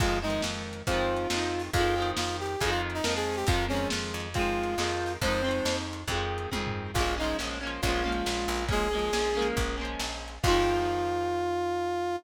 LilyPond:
<<
  \new Staff \with { instrumentName = "Brass Section" } { \time 4/4 \key f \minor \tempo 4 = 138 f'8 ees'8 r4 f'2 | f'4 f'8 g'8 aes'16 f'16 r16 ees'16 bes'16 aes'8 g'16 | f'8 des'8 r4 f'2 | c''4. r2 r8 |
f'8 ees'8 r4 f'2 | aes'2 r2 | f'1 | }
  \new Staff \with { instrumentName = "Overdriven Guitar" } { \time 4/4 \key f \minor <ees f aes c'>8 <ees f aes c'>4. <ees f aes c'>4 <ees f aes c'>4 | <ees f aes c'>8 <ees f aes c'>4. <ees f aes c'>4 <ees f aes c'>4 | <ees f aes c'>8 <ees f aes c'>4. <ees f aes c'>4 <ees f aes c'>4 | <ees f aes c'>8 <ees f aes c'>4. <ees f aes c'>4 <ees f aes c'>4 |
<f aes bes des'>8 <f aes bes des'>8 <f aes bes des'>8 <f aes bes des'>8 <f aes bes des'>8 <f aes bes des'>4. | <f aes bes des'>8 <f aes bes des'>8 <f aes bes des'>8 <f aes bes des'>4 <f aes bes des'>4. | <ees f aes c'>1 | }
  \new Staff \with { instrumentName = "Electric Bass (finger)" } { \clef bass \time 4/4 \key f \minor f,4 f,4 f,4 f,4 | f,4 f,4 f,4 f,4 | f,4 f,8 f,4. f,4 | f,4 f,4 f,4 f,4 |
bes,,4 bes,,4 bes,,4 bes,,8 bes,,8~ | bes,,4 bes,,4 bes,,4 bes,,4 | f,1 | }
  \new DrumStaff \with { instrumentName = "Drums" } \drummode { \time 4/4 \tuplet 3/2 { <cymc bd>8 r8 hh8 sn8 r8 hh8 <hh bd>8 r8 hh8 sn8 r8 hho8 } | \tuplet 3/2 { <hh bd>8 r8 hh8 sn8 r8 hh8 <hh bd>8 r8 hh8 sn8 r8 hho8 } | \tuplet 3/2 { <hh bd>8 r8 hh8 sn8 r8 hh8 <hh bd>8 r8 hh8 sn8 r8 hho8 } | \tuplet 3/2 { <hh bd>8 r8 hh8 sn8 r8 hh8 <hh bd>8 r8 hh8 <bd tommh>8 tomfh8 r8 } |
\tuplet 3/2 { <cymc bd>8 r8 hh8 sn8 r8 hh8 <hh bd>8 r8 hh8 sn8 r8 hho8 } | \tuplet 3/2 { <hh bd>8 r8 hh8 sn8 r8 hh8 <hh bd>8 r8 hh8 sn8 r8 hh8 } | <cymc bd>4 r4 r4 r4 | }
>>